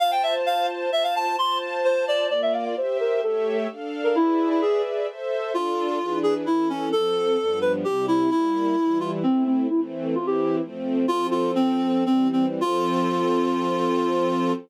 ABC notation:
X:1
M:3/4
L:1/16
Q:1/4=130
K:F
V:1 name="Clarinet"
f g e z f2 z2 e f a2 | c'2 z2 c2 d2 d e f f | c2 B2 A3 z4 B | E3 E ^G2 z6 |
[K:Dm] F6 ^G z E2 ^C2 | A6 =B z G2 E2 | E6 F z C2 C2 | E z3 F G3 z4 |
[K:F] "^rit." F2 F2 C4 C2 C z | F12 |]
V:2 name="String Ensemble 1"
[Fca]8 [Fca]4 | [Fca]8 [B,Fd]4 | [Gce]4 [A,G^ce]4 [DAf]4 | [^G=Bde]8 [Ace]4 |
[K:Dm] [DFA]4 [E,D^G=B]4 [E,^CA]4 | [F,CA]4 [G,,F,=B,D]4 [C,G,E]4 | [G,B,E]4 [E,G,E]4 [A,CE]4 | [E,A,C]4 [E,CE]4 [F,A,C]4 |
[K:F] "^rit." [F,CA]8 [E,G,C]4 | [F,CA]12 |]